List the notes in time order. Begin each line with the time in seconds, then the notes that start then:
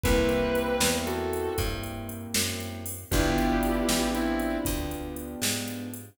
0.03 C2 A#3 C4 E4 G4 B4, kick, closed hi-hat
0.29 closed hi-hat
0.55 closed hi-hat
0.80 E2, snare
1.06 F#4 A4, closed hi-hat
1.33 closed hi-hat
1.58 G2, kick, closed hi-hat
1.83 closed hi-hat
2.09 closed hi-hat
2.34 F#2, snare
2.60 closed hi-hat
2.86 open hi-hat
3.11 G1 B3 D4 E4 F4 G4, kick, closed hi-hat
3.38 closed hi-hat
3.63 closed hi-hat
3.89 A1, snare
4.15 C4 E4, closed hi-hat
4.39 closed hi-hat
4.65 D2, kick, closed hi-hat
4.91 closed hi-hat
5.16 closed hi-hat
5.42 G#2, snare
5.68 closed hi-hat
5.94 closed hi-hat